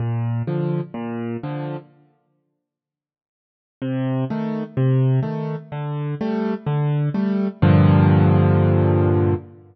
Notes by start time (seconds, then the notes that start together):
0.00 A#2
0.47 D3 F3
0.94 A#2
1.43 D3 F3
3.82 C3
4.30 D#3 A3
4.77 C3
5.23 D#3 A3
5.72 D3
6.21 G3 A3
6.66 D3
7.14 G3 A3
7.62 G2 A#2 D3 F3